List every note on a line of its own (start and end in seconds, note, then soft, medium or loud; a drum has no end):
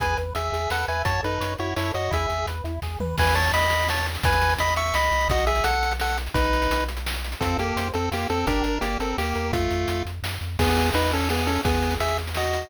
0.00 0.15 E2 medium
0.00 0.15 G#4 medium
0.00 0.17 B4 medium
0.00 0.17 G#5 medium
0.00 kick medium
0.00 closed hi-hat medium
0.17 0.33 E2 medium
0.17 0.34 B4 medium
0.17 closed hi-hat soft
0.35 0.50 E2 medium
0.35 0.70 G#4 medium
0.35 0.50 E5 medium
0.35 0.70 E5 medium
0.35 closed hi-hat medium
0.52 0.67 E2 medium
0.52 0.69 G#4 medium
0.52 closed hi-hat medium
0.70 0.85 E2 medium
0.70 0.86 A4 medium
0.70 0.87 B4 medium
0.70 0.86 F#5 medium
0.70 snare medium
0.88 1.03 E2 medium
0.88 1.02 B4 medium
0.88 1.04 E5 medium
0.88 1.02 G#5 medium
0.88 closed hi-hat soft
1.05 1.21 F#2 medium
1.05 1.21 F#4 medium
1.05 1.21 C#5 medium
1.05 1.21 A5 loud
1.05 kick medium
1.05 closed hi-hat medium
1.23 1.39 F#2 medium
1.23 1.54 D#4 medium
1.23 1.39 A4 medium
1.23 1.54 B4 medium
1.23 closed hi-hat medium
1.40 1.56 F#2 medium
1.40 1.56 C#5 medium
1.40 closed hi-hat medium
1.58 1.74 F#2 medium
1.58 1.74 E4 medium
1.58 1.75 F#4 medium
1.58 1.74 C#5 medium
1.58 closed hi-hat soft
1.76 1.92 F#2 medium
1.76 1.92 E4 medium
1.76 1.93 A4 medium
1.76 1.92 C#5 medium
1.76 snare medium
1.94 2.09 F#2 medium
1.94 2.11 F#4 medium
1.94 2.10 C#5 medium
1.94 2.11 D#5 medium
1.94 closed hi-hat medium
2.11 2.27 E2 medium
2.11 2.27 E4 medium
2.11 2.46 G#4 medium
2.11 2.46 E5 medium
2.11 kick medium
2.11 closed hi-hat medium
2.29 2.45 E2 medium
2.29 2.45 G#4 medium
2.29 closed hi-hat soft
2.47 2.62 E2 medium
2.47 2.64 B4 medium
2.47 closed hi-hat medium
2.64 2.79 E2 medium
2.64 2.80 E4 medium
2.64 closed hi-hat medium
2.82 2.97 E2 medium
2.82 2.99 G#4 medium
2.82 kick medium
2.82 snare medium
3.00 3.15 E2 medium
3.00 3.16 B4 medium
3.00 mid tom medium
3.18 3.51 E2 medium
3.18 3.35 B4 loud
3.18 3.35 G#5 loud
3.18 kick medium
3.18 crash medium
3.27 closed hi-hat medium
3.35 3.52 C#5 medium
3.35 3.52 A5 loud
3.35 closed hi-hat medium
3.44 closed hi-hat medium
3.53 4.18 E2 medium
3.53 3.88 D#5 medium
3.53 3.88 B5 medium
3.53 closed hi-hat medium
3.61 closed hi-hat medium
3.70 closed hi-hat medium
3.80 closed hi-hat medium
3.88 4.06 C#5 medium
3.88 4.06 A5 medium
3.88 snare medium
3.98 closed hi-hat medium
4.06 closed hi-hat medium
4.15 closed hi-hat medium
4.23 4.56 E2 medium
4.23 4.54 B4 loud
4.23 4.54 G#5 loud
4.23 kick loud
4.23 closed hi-hat loud
4.32 closed hi-hat medium
4.42 closed hi-hat medium
4.50 closed hi-hat medium
4.58 4.92 E2 medium
4.58 4.74 D#5 medium
4.58 4.74 B5 medium
4.58 closed hi-hat medium
4.68 closed hi-hat medium
4.76 4.94 E5 medium
4.76 4.94 C#6 loud
4.76 closed hi-hat medium
4.86 closed hi-hat medium
4.94 5.10 C#2 medium
4.94 5.28 D#5 medium
4.94 5.28 B5 loud
4.94 snare medium
5.03 closed hi-hat medium
5.11 5.27 C2 medium
5.11 closed hi-hat medium
5.21 closed hi-hat medium
5.29 5.61 B1 medium
5.29 5.45 F#4 medium
5.29 5.45 D#5 loud
5.29 kick medium
5.29 closed hi-hat medium
5.38 closed hi-hat medium
5.47 5.64 G#4 medium
5.47 5.64 E5 loud
5.47 closed hi-hat medium
5.55 closed hi-hat medium
5.64 6.29 B1 medium
5.64 5.93 A4 medium
5.64 5.93 F#5 loud
5.64 closed hi-hat medium
5.73 closed hi-hat medium
5.83 closed hi-hat medium
5.91 closed hi-hat medium
6.00 6.17 A4 medium
6.00 6.17 F#5 medium
6.00 snare medium
6.08 closed hi-hat medium
6.18 closed hi-hat medium
6.26 closed hi-hat medium
6.34 6.68 B1 medium
6.34 6.84 D#4 loud
6.34 6.84 B4 loud
6.34 kick medium
6.34 closed hi-hat medium
6.44 closed hi-hat medium
6.53 closed hi-hat medium
6.62 closed hi-hat medium
6.70 7.35 B1 medium
6.70 closed hi-hat medium
6.80 closed hi-hat medium
6.88 closed hi-hat medium
6.97 closed hi-hat medium
7.06 snare medium
7.14 closed hi-hat medium
7.24 closed hi-hat medium
7.32 closed hi-hat medium
7.40 7.56 F2 medium
7.40 7.57 C4 medium
7.40 7.57 F4 medium
7.40 7.57 A4 loud
7.40 kick medium
7.40 closed hi-hat medium
7.58 7.73 F2 medium
7.58 7.88 A#3 medium
7.58 7.88 G4 medium
7.58 7.74 A4 medium
7.58 closed hi-hat medium
7.76 7.91 F2 medium
7.76 7.93 C5 medium
7.76 closed hi-hat medium
7.93 8.10 F2 medium
7.93 8.09 C4 medium
7.93 8.09 A4 medium
7.93 closed hi-hat medium
8.11 8.26 F2 medium
8.11 8.27 A#3 medium
8.11 8.27 F4 medium
8.11 8.27 G4 medium
8.11 snare medium
8.30 8.45 F2 medium
8.30 8.46 C4 medium
8.30 8.45 A4 medium
8.30 8.46 A4 loud
8.30 closed hi-hat medium
8.47 8.62 G1 medium
8.47 8.78 D4 medium
8.47 8.63 G4 loud
8.47 8.78 A#4 loud
8.47 kick medium
8.47 closed hi-hat medium
8.64 8.79 G1 medium
8.64 8.81 A#4 medium
8.64 closed hi-hat medium
8.81 8.97 G1 medium
8.81 8.98 A#3 medium
8.81 8.98 G4 medium
8.81 8.98 D5 medium
8.81 closed hi-hat medium
8.99 9.14 G1 medium
8.99 9.17 C4 medium
8.99 9.17 A4 medium
8.99 9.16 A#4 medium
8.99 closed hi-hat medium
9.18 9.34 D#2 medium
9.18 9.52 A#3 medium
9.18 9.34 G4 medium
9.18 9.52 G4 medium
9.18 snare medium
9.35 9.52 E2 medium
9.35 9.51 A#4 medium
9.35 closed hi-hat medium
9.52 9.67 F2 medium
9.52 10.03 A3 medium
9.52 10.03 F4 loud
9.52 kick medium
9.52 closed hi-hat medium
9.71 9.86 F2 medium
9.71 closed hi-hat medium
9.88 10.03 F2 medium
9.88 closed hi-hat medium
10.05 10.20 F2 medium
10.05 closed hi-hat medium
10.23 10.39 F#2 medium
10.23 snare medium
10.41 10.57 F2 medium
10.41 closed hi-hat medium
10.59 10.91 E2 medium
10.59 10.90 B3 loud
10.59 10.90 G#4 loud
10.59 kick medium
10.59 crash loud
10.68 closed hi-hat medium
10.76 closed hi-hat medium
10.86 closed hi-hat medium
10.94 11.59 E2 medium
10.94 11.12 D#4 medium
10.94 11.12 B4 loud
10.94 closed hi-hat medium
11.02 closed hi-hat medium
11.12 11.29 C#4 medium
11.12 11.29 A4 medium
11.12 closed hi-hat medium
11.20 closed hi-hat medium
11.29 11.47 B3 medium
11.29 11.47 G#4 medium
11.29 snare medium
11.38 closed hi-hat medium
11.47 11.61 C#4 medium
11.47 11.61 A4 loud
11.47 closed hi-hat medium
11.56 closed hi-hat medium
11.64 11.97 E2 medium
11.64 11.94 B3 medium
11.64 11.94 G#4 loud
11.64 kick medium
11.64 closed hi-hat medium
11.74 closed hi-hat medium
11.82 closed hi-hat medium
11.91 closed hi-hat medium
12.00 12.65 E2 medium
12.00 12.17 G#4 medium
12.00 12.17 E5 medium
12.00 closed hi-hat medium
12.08 closed hi-hat medium
12.18 closed hi-hat medium
12.27 closed hi-hat medium
12.34 12.69 F#4 medium
12.34 12.69 D#5 loud
12.34 snare medium
12.44 closed hi-hat medium
12.53 closed hi-hat medium
12.62 closed hi-hat medium